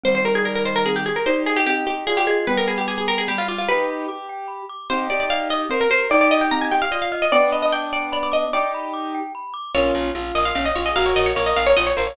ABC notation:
X:1
M:6/8
L:1/16
Q:3/8=99
K:Cm
V:1 name="Pizzicato Strings"
c c B A B B c B A G A B | c2 A G G2 G2 A G A2 | =B _B A G A A B A G F F F | =B10 z2 |
c2 d d f2 e2 c B c2 | d d e g b a g f e f f e | d2 e e g2 d2 d d e2 | d8 z4 |
[K:Bbm] d6 e f f e d e | f d e d d e f d e d c d |]
V:2 name="Acoustic Grand Piano"
[E,G,]12 | [EG]8 F4 | [G,=B,]8 G,4 | [EG]4 G6 z2 |
[EG]8 B4 | [EG]8 F4 | [=B,D]12 | [EG]8 z4 |
[K:Bbm] [DF]4 F3 F D z F A | [GB]4 B3 B F z B d |]
V:3 name="Glockenspiel"
C2 G2 d2 e2 C2 G2 | d2 e2 C2 G2 d2 e2 | g2 =b2 d'2 g2 b2 d'2 | g2 =b2 d'2 g2 b2 d'2 |
C2 G2 d2 e2 C2 G2 | d2 e2 C2 G2 d2 e2 | g2 =b2 d'2 g2 b2 d'2 | g2 =b2 d'2 g2 b2 d'2 |
[K:Bbm] B2 d2 f2 B2 d2 f2 | B2 d2 f2 B2 d2 f2 |]
V:4 name="Electric Bass (finger)" clef=bass
z12 | z12 | z12 | z12 |
z12 | z12 | z12 | z12 |
[K:Bbm] B,,,2 B,,,2 B,,,2 B,,,2 B,,,2 B,,,2 | B,,,2 B,,,2 B,,,2 B,,,2 B,,,2 B,,,2 |]